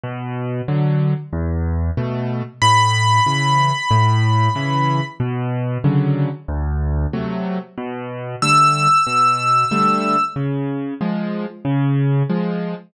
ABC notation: X:1
M:4/4
L:1/8
Q:1/4=93
K:Bm
V:1 name="Acoustic Grand Piano"
z8 | b8 | z8 | z2 e'6 |
z8 |]
V:2 name="Acoustic Grand Piano"
B,,2 [D,F,]2 E,,2 [B,,A,]2 | A,,2 [C,E,]2 A,,2 [C,E,]2 | B,,2 [C,D,F,]2 D,,2 [=C,F,A,]2 | B,,2 [D,G,A,]2 B,,2 [D,G,A,]2 |
C,2 [^E,^G,]2 C,2 [E,G,]2 |]